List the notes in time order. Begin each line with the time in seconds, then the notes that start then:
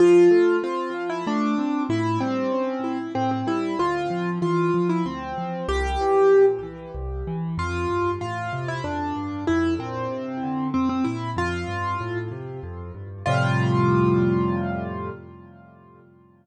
0.00 F3 F4
0.31 A3
0.63 C4 F4
0.94 F3
1.09 E4
1.27 A3 D4
1.58 C4
1.89 A2 E4
2.21 G3 C4
2.52 C#4
2.84 E4
3.15 A2 C4
3.31 C4
3.47 G3 E4
3.79 D2 F4
4.10 F3
4.42 E3 F4
4.74 F3
4.89 E4
5.05 D2 C4
5.38 F3
5.68 C2 G4
6.01 E3
6.33 A#2
6.63 E3
6.95 C2
7.27 E3
7.58 F2 F4
7.89 G2
8.21 A2 F4
8.53 C3
8.68 E4
8.84 F2 D4
9.16 G2
9.47 F2 E4
9.79 A#2 C4
10.11 C3
10.43 D3
10.74 F2 C4
10.89 C4
11.04 A#2 E4
11.36 F2 F4
11.68 G2
12.01 A2
12.31 C3
12.63 F2
12.94 G2
13.26 F2 A2 C3 G3 F4